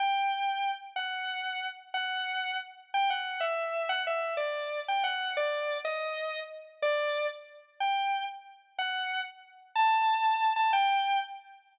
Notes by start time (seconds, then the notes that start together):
0.00 G5
0.96 F#5
1.94 F#5
2.94 G5
3.10 F#5
3.40 E5
3.89 F#5
4.07 E5
4.37 D5
4.88 G5
5.04 F#5
5.37 D5
5.85 D#5
6.82 D5
7.80 G5
8.79 F#5
9.75 A5
10.56 A5
10.73 G5